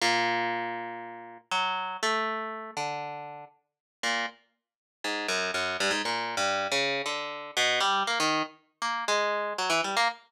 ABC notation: X:1
M:4/4
L:1/16
Q:1/4=119
K:none
V:1 name="Orchestral Harp"
^A,,12 ^F,4 | A,6 D,6 z4 | ^A,,2 z6 ^G,,2 ^F,,2 F,,2 =G,, ^G,, | (3^A,,4 G,,4 ^C,4 D,4 B,,2 G,2 |
^A, ^D,2 z3 A,2 ^G,4 ^F, E, =G, A, |]